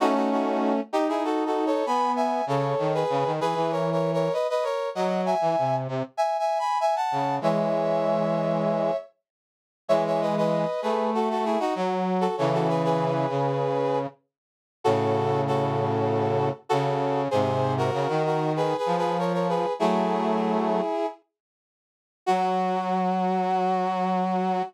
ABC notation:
X:1
M:4/4
L:1/16
Q:1/4=97
K:F#dor
V:1 name="Brass Section"
[DF] [DF] [DF]3 z [D=G] [E^G] (3[FA]2 [FA]2 [Ac]2 [gb]2 [eg]2 | [Ac]3 [GB]3 [GB]2 (3[^Ac]2 [Ac]2 [Ac]2 [Bd] [Bd] [Ac]2 | [df]2 [eg]4 z2 (3[eg]2 [eg]2 [gb]2 [eg] [fa]3 | [ce]12 z4 |
[ce] [ce] [Bd] [Bd]3 [GB]2 [FA] [FA] [EG] [DF] z3 [FA] | [Ac] [FA] [GB] [GB]9 z4 | [FA]4 [FA]8 [FA]4 | [G^B]3 [F^A]3 [FA]2 (3[G=B]2 [GB]2 [GB]2 [Ac] [Ac] [GB]2 |
[EG]10 z6 | F16 |]
V:2 name="Brass Section"
[A,C]6 D6 B,4 | C,2 D,2 C, D, E, E,5 z4 | F,3 E, ^B,,2 B,, z7 C,2 | [E,G,]10 z6 |
[E,G,]6 A,6 F,4 | [C,E,]6 C,6 z4 | [A,,C,]12 C,4 | [G,,^B,,]4 C, D,5 ^E,6 |
[F,A,]8 z8 | F,16 |]